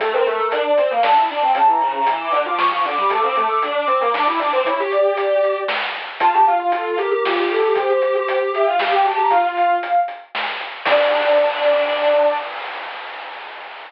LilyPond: <<
  \new Staff \with { instrumentName = "Ocarina" } { \time 3/4 \key d \minor \tempo 4 = 116 a'16 bes'4 d''8 f''16 a''8 a''16 g''16 | a''16 bes''4 d'''8 d'''16 cis'''8 d'''16 d'''16 | d'''16 d'''4 d'''8 d'''16 d'''8 d'''16 d'''16 | cis''8 d''4. r4 |
a''8 f''16 f''16 a'8 bes'8 f'8 a'8 | c''4. e''16 f''16 f''16 g''16 a''16 bes''16 | f''4. r4. | d''2. | }
  \new Staff \with { instrumentName = "Lead 1 (square)" } { \time 3/4 \key d \minor a16 c'16 a16 a16 d'8 c'16 bes16 d'16 e'16 d'16 c'16 | cis16 e16 cis16 cis16 e8 d16 f16 f16 f16 d16 g16 | a16 c'16 a16 a16 d'8 c'16 bes16 d'16 e'16 d'16 c'16 | e'16 g'4.~ g'16 r4 |
f'16 g'16 f'16 f'16 f'8 g'16 g'16 g'16 g'16 g'16 g'16 | g'16 g'16 g'16 g'16 g'8 g'16 f'16 g'16 g'16 g'16 g'16 | f'4 r2 | d'2. | }
  \new DrumStaff \with { instrumentName = "Drums" } \drummode { \time 3/4 <hh bd>8 hh8 hh8 hh8 sn8 hh8 | <hh bd>8 hh8 hh8 hh8 sn8 hh8 | <hh bd>8 hh8 hh8 hh8 sn8 hho8 | <hh bd>8 hh8 hh8 hh8 sn8 hh8 |
<hh bd>8 hh8 hh8 hh8 sn8 hho8 | <hh bd>8 hh8 hh8 hh8 sn8 hh8 | <hh bd>8 hh8 hh8 hh8 sn8 hh8 | <cymc bd>4 r4 r4 | }
>>